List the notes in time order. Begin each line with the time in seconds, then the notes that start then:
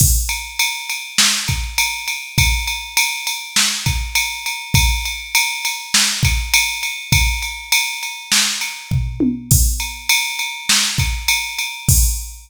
0.00 kick, crash
0.29 ride
0.59 ride
0.89 ride
1.18 snare
1.48 kick, ride
1.78 ride
2.08 ride
2.38 kick, ride
2.67 ride
2.97 ride
3.27 ride
3.56 snare
3.86 kick, ride
4.15 ride
4.46 ride
4.74 kick, ride
5.05 ride
5.35 ride
5.65 ride
5.94 snare
6.23 kick, ride
6.54 ride
6.83 ride
7.12 kick, ride
7.42 ride
7.72 ride
8.03 ride
8.32 snare
8.61 ride
8.91 kick, floor tom
9.20 high tom
9.51 kick, crash
9.80 ride
10.09 ride
10.39 ride
10.69 snare
10.98 kick, ride
11.28 ride
11.59 ride
11.88 kick, crash